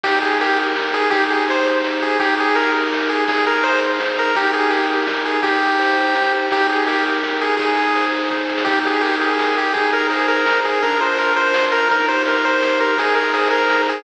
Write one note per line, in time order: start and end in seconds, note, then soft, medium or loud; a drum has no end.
0.04 1.04 D#2 medium
0.04 0.76 D#4 loud
0.04 0.19 G4 loud
0.04 kick loud
0.04 crash loud
0.22 0.58 G4 medium
0.22 0.38 G#4 medium
0.41 0.59 G4 medium
0.41 1.09 A#4 medium
0.41 ride medium
0.58 0.94 G4 medium
0.58 ride medium
0.76 1.10 D#4 medium
0.76 snare loud
0.94 1.12 G4 medium
0.94 1.09 G#4 loud
0.94 ride medium
1.10 2.10 C2 medium
1.10 1.83 D#4 loud
1.10 1.25 G4 loud
1.10 kick loud
1.10 ride loud
1.30 1.66 G4 medium
1.30 1.45 G#4 medium
1.30 ride medium
1.48 2.17 C5 medium
1.48 1.67 C5 medium
1.48 ride medium
1.66 2.01 G4 medium
1.66 ride medium
1.84 2.18 D#4 loud
1.84 snare medium
2.02 2.19 G4 medium
2.02 2.19 G#4 medium
2.02 ride medium
2.19 3.19 G1 medium
2.19 2.91 D#4 loud
2.19 2.35 G4 loud
2.19 kick loud
2.19 ride loud
2.38 2.73 G4 medium
2.38 2.56 G#4 loud
2.38 ride medium
2.55 2.72 A#4 medium
2.55 3.24 A#4 medium
2.55 ride loud
2.74 3.09 G4 medium
2.74 ride medium
2.92 3.26 D#4 loud
2.92 snare loud
3.09 3.27 G4 medium
3.09 3.25 G#4 medium
3.09 ride medium
3.28 4.27 G#1 medium
3.28 3.99 D#4 loud
3.28 3.45 G#4 medium
3.28 kick loud
3.28 ride loud
3.45 3.81 G#4 medium
3.45 3.64 A#4 medium
3.45 ride medium
3.63 4.32 C5 medium
3.63 3.80 C5 medium
3.63 ride loud
3.81 4.17 G#4 medium
3.81 ride medium
4.00 4.34 D#4 medium
4.00 snare loud
4.18 4.35 G#4 loud
4.18 4.36 A#4 medium
4.18 ride medium
4.35 5.36 D#2 medium
4.35 5.07 D#4 loud
4.35 4.51 G4 loud
4.35 kick medium
4.35 ride loud
4.53 4.89 G4 medium
4.53 4.71 G#4 medium
4.53 ride medium
4.70 4.88 G4 medium
4.70 5.40 A#4 medium
4.70 ride loud
4.89 5.25 G4 medium
4.89 ride medium
5.07 5.42 D#4 loud
5.07 snare loud
5.25 5.42 G4 medium
5.25 5.41 G#4 medium
5.25 ride medium
5.43 6.42 C2 medium
5.43 6.15 D#4 loud
5.43 6.33 G4 medium
5.43 kick loud
5.43 ride loud
5.61 5.97 G4 medium
5.61 ride medium
5.79 6.47 C5 medium
5.79 ride loud
5.97 6.32 G4 medium
5.97 ride medium
6.15 6.49 D#4 medium
6.15 snare loud
6.33 6.50 G4 medium
6.33 ride medium
6.51 7.50 D#2 medium
6.51 7.23 D#4 loud
6.51 6.67 G4 loud
6.51 kick loud
6.51 ride loud
6.69 7.05 G4 medium
6.69 6.84 G#4 medium
6.69 ride medium
6.87 7.04 G4 medium
6.87 7.55 A#4 medium
6.87 ride loud
7.04 7.41 G4 medium
7.04 ride medium
7.23 7.57 D#4 medium
7.23 snare medium
7.41 7.58 G4 medium
7.41 7.56 G#4 medium
7.41 ride medium
7.57 8.58 G#1 medium
7.57 8.30 D#4 loud
7.57 8.06 G#4 medium
7.57 kick loud
7.57 ride loud
7.76 8.12 G#4 medium
7.76 ride medium
7.95 8.63 C5 medium
7.95 ride medium
8.12 8.49 G#4 medium
8.12 ride medium
8.31 8.65 D#4 medium
8.31 kick medium
8.31 snare medium
8.49 8.66 G#4 medium
8.49 snare medium
8.58 snare loud
8.65 9.66 D#2 medium
8.65 9.38 D#4 loud
8.65 8.79 G4 loud
8.65 kick loud
8.65 crash loud
8.85 9.20 G4 medium
8.85 9.02 G#4 medium
8.85 ride medium
9.01 9.16 G4 medium
9.01 9.71 A#4 medium
9.01 ride loud
9.21 9.56 G4 medium
9.21 9.56 G#4 medium
9.21 ride medium
9.39 9.73 D#4 medium
9.39 snare loud
9.56 9.74 G4 medium
9.56 9.73 G4 medium
9.56 ride medium
9.74 10.74 G#1 medium
9.74 10.46 D#4 loud
9.74 9.91 G#4 medium
9.74 kick loud
9.74 ride medium
9.92 10.28 G#4 medium
9.92 10.07 A#4 medium
9.92 ride medium
10.10 10.27 G#4 medium
10.10 10.79 C5 medium
10.10 ride loud
10.28 10.63 G#4 medium
10.28 10.60 A#4 medium
10.28 ride medium
10.46 10.80 D#4 medium
10.46 snare loud
10.64 10.81 G#4 medium
10.64 10.82 G#4 medium
10.64 ride medium
10.81 11.80 A#1 medium
10.81 11.54 D4 loud
10.81 11.00 A#4 medium
10.81 kick medium
10.81 ride medium
11.00 11.36 F4 medium
11.00 11.18 C5 medium
11.00 ride medium
11.18 11.86 A#4 medium
11.18 11.34 A#4 medium
11.18 ride medium
11.36 11.72 F4 medium
11.36 11.65 C5 medium
11.36 ride medium
11.54 11.88 D4 medium
11.54 snare loud
11.72 11.90 F4 medium
11.72 11.88 A#4 loud
11.72 ride medium
11.90 12.89 D#2 medium
11.90 12.61 D#4 loud
11.90 12.06 A#4 medium
11.90 kick loud
11.90 ride loud
12.08 12.43 G4 medium
12.08 12.23 C5 medium
12.08 ride medium
12.25 12.95 A#4 medium
12.25 12.45 A#4 medium
12.25 ride loud
12.44 12.79 G4 medium
12.44 12.79 C5 medium
12.44 ride medium
12.62 12.96 D#4 medium
12.62 snare loud
12.80 12.97 G4 medium
12.80 12.98 A#4 medium
12.80 ride medium
12.97 13.97 G#1 medium
12.97 13.69 D#4 medium
12.97 13.15 G#4 loud
12.97 kick medium
12.97 ride loud
13.15 13.52 G#4 medium
13.15 13.32 A#4 medium
13.15 ride medium
13.34 13.48 G#4 medium
13.34 14.02 C5 medium
13.34 ride loud
13.50 13.87 G#4 loud
13.50 13.82 A#4 medium
13.50 ride medium
13.69 14.03 D#4 loud
13.69 snare loud
13.87 14.03 G#4 medium
13.87 14.03 G#4 loud
13.87 ride medium